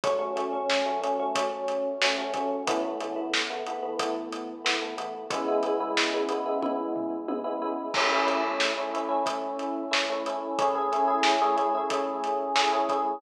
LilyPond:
<<
  \new Staff \with { instrumentName = "Electric Piano 1" } { \time 4/4 \key a \major \tempo 4 = 91 <fis a cis'>16 <fis a cis'>16 <fis a cis'>16 <fis a cis'>8 <fis a cis'>16 <fis a cis'>16 <fis a cis'>16 <fis a cis'>4 <fis a cis'>16 <fis a cis'>16 <fis a cis'>8 | <e a b>16 <e a b>16 <e a b>16 <e a b>8 <e a b>16 <e a b>16 <e a b>16 <e a b>4 <e a b>16 <e a b>16 <e a b>8 | <cis gis b e'>16 <cis gis b e'>16 <cis gis b e'>16 <cis gis b e'>8 <cis gis b e'>16 <cis gis b e'>16 <cis gis b e'>16 <cis gis b e'>4 <cis gis b e'>16 <cis gis b e'>16 <cis gis b e'>8 | <a cis' e'>16 <a cis' e'>16 <a cis' e'>16 <a cis' e'>8 <a cis' e'>16 <a cis' e'>16 <a cis' e'>16 <a cis' e'>4 <a cis' e'>16 <a cis' e'>16 <a cis' e'>8 |
<a cis' e' gis'>16 <a cis' e' gis'>16 <a cis' e' gis'>16 <a cis' e' gis'>8 <a cis' e' gis'>16 <a cis' e' gis'>16 <a cis' e' gis'>16 <a cis' e' gis'>4 <a cis' e' gis'>16 <a cis' e' gis'>16 <a cis' e' gis'>8 | }
  \new DrumStaff \with { instrumentName = "Drums" } \drummode { \time 4/4 <hh bd>8 hh8 sn8 hh8 <hh bd>8 hh8 sn8 <hh bd>8 | <hh bd>8 hh8 sn8 hh8 <hh bd>8 hh8 sn8 hh8 | <hh bd>8 hh8 sn8 hh8 <bd tommh>8 tomfh8 tommh4 | <cymc bd>8 hh8 sn8 hh8 <hh bd>8 hh8 sn8 hh8 |
<hh bd>8 hh8 sn8 hh8 <hh bd>8 hh8 sn8 <hh bd>8 | }
>>